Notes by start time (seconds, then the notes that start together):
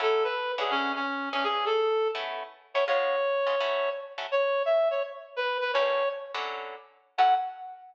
0.00 F#3 C#4 E4 A4
0.24 B4
0.58 D3 C#4 E4 F#4 G#4
0.70 C#4
0.95 C#4
1.33 E3 C#4 D4 G#4
1.44 G#4
1.66 A4
2.15 A3 B3 C#4 E4
2.74 A3 B3 C#4 E4 C#5
2.88 C#3 G#3 B3 F4 C#5
3.47 C#3 G#3 B3 F4
3.60 F#3 A3 C#4 E4
4.18 F#3 A3 C#4 E4
4.32 C#5
4.65 E5
4.91 C#5
5.36 B4
5.61 B4
5.74 A2 G3 A#3 C#4 C#5
6.34 D3 F#3 C#4 E4
7.18 F#3 C#4 E4 A4 F#5